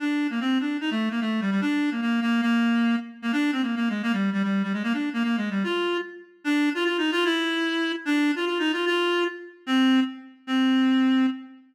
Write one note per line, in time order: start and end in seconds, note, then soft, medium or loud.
0.00 0.27 D4 medium
0.30 0.40 A#3 medium
0.40 0.58 C4 medium
0.60 0.77 D4 medium
0.81 0.90 D#4 medium
0.91 1.09 A3 medium
1.11 1.20 A#3 medium
1.21 1.41 A3 medium
1.41 1.51 G3 medium
1.51 1.61 G3 medium
1.61 1.90 D4 loud
1.91 2.01 A#3 medium
2.01 2.20 A#3 medium
2.21 2.41 A#3 loud
2.42 2.96 A#3 loud
3.22 3.32 A#3 medium
3.32 3.51 D4 loud
3.52 3.62 C4 medium
3.62 3.75 A#3 medium
3.76 3.89 A#3 medium
3.89 4.02 G#3 medium
4.03 4.12 A#3 loud
4.13 4.30 G3 medium
4.33 4.42 G3 medium
4.43 4.63 G3 medium
4.63 4.73 G3 medium
4.73 4.83 G#3 medium
4.83 4.93 A#3 loud
4.93 5.09 D4 medium
5.13 5.23 A#3 medium
5.23 5.36 A#3 medium
5.37 5.50 G#3 medium
5.50 5.63 G3 medium
5.64 5.97 F4 loud
6.44 6.70 D4 loud
6.74 6.84 F4 loud
6.85 6.97 F4 loud
6.98 7.11 D#4 loud
7.11 7.24 F4 loud
7.25 7.92 E4 loud
8.05 8.31 D4 loud
8.36 8.45 F4 loud
8.46 8.58 F4 medium
8.59 8.72 D#4 loud
8.72 8.85 F4 loud
8.86 9.24 F4 loud
9.66 10.00 C4 loud
10.47 11.26 C4 loud